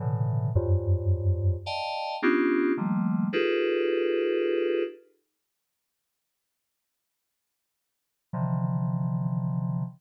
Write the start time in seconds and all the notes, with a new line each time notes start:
0.00 A2 B2 C#3 D3 E3
0.55 F2 F#2 G2
1.66 D5 D#5 F5 G5 A5
2.22 B3 C#4 D4 D#4 F4 G4
2.77 D#3 F3 G3 A3 A#3
3.33 D#4 F4 G4 G#4 A4 B4
8.33 C3 D3 D#3 E3 F3